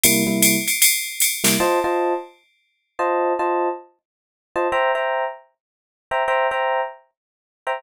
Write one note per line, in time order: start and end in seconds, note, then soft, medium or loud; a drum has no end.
0.03 0.23 C3 medium
0.03 0.23 G3 medium
0.03 0.23 A#3 medium
0.03 0.23 E4 medium
0.03 ride loud
0.27 0.56 C3 medium
0.27 0.56 G3 medium
0.27 0.56 A#3 medium
0.27 0.56 E4 medium
0.42 hi-hat pedal medium
0.42 ride loud
0.68 ride medium
0.82 ride loud
1.20 hi-hat pedal medium
1.20 ride medium
1.44 1.56 C3 medium
1.44 1.56 G3 medium
1.44 1.56 A#3 medium
1.44 1.56 E4 medium
1.44 snare medium
1.44 ride medium
1.60 1.79 F4 medium
1.60 1.79 C5 medium
1.60 1.79 D#5 medium
1.60 1.79 A5 medium
1.84 2.13 F4 medium
1.84 2.13 C5 medium
1.84 2.13 D#5 medium
1.84 2.13 A5 medium
2.99 3.33 F4 medium
2.99 3.33 C5 medium
2.99 3.33 D#5 medium
2.99 3.33 A5 medium
3.39 3.69 F4 medium
3.39 3.69 C5 medium
3.39 3.69 D#5 medium
3.39 3.69 A5 medium
4.56 4.68 F4 medium
4.56 4.68 C5 medium
4.56 4.68 D#5 medium
4.56 4.68 A5 medium
4.72 4.91 C5 medium
4.72 4.91 E5 medium
4.72 4.91 G5 medium
4.72 4.91 A#5 medium
4.95 5.24 C5 medium
4.95 5.24 E5 medium
4.95 5.24 G5 medium
4.95 5.24 A#5 medium
6.11 6.23 C5 medium
6.11 6.23 E5 medium
6.11 6.23 G5 medium
6.11 6.23 A#5 medium
6.28 6.47 C5 medium
6.28 6.47 E5 medium
6.28 6.47 G5 medium
6.28 6.47 A#5 medium
6.51 6.81 C5 medium
6.51 6.81 E5 medium
6.51 6.81 G5 medium
6.51 6.81 A#5 medium
7.67 7.79 C5 medium
7.67 7.79 E5 medium
7.67 7.79 G5 medium
7.67 7.79 A#5 medium